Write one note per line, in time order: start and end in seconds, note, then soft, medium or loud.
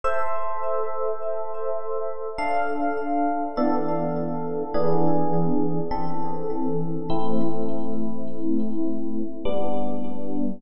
0.04 2.16 A4 loud
0.04 2.16 C5 loud
0.04 2.16 E5 loud
2.38 3.44 D4 medium
2.38 3.44 A4 medium
2.38 3.44 F5 loud
3.57 4.63 E3 loud
3.57 4.63 B3 medium
3.57 4.63 D4 loud
3.57 4.63 A4 loud
4.74 5.80 E3 loud
4.74 5.80 B3 loud
4.74 5.80 D4 loud
4.74 5.80 G#4 loud
5.91 6.97 E3 loud
5.91 6.97 C4 medium
5.91 6.97 A4 medium
7.10 9.21 A3 medium
7.10 9.21 C4 loud
7.10 9.21 E4 loud
9.45 10.51 G3 medium
9.45 10.51 B3 loud
9.45 10.51 D4 loud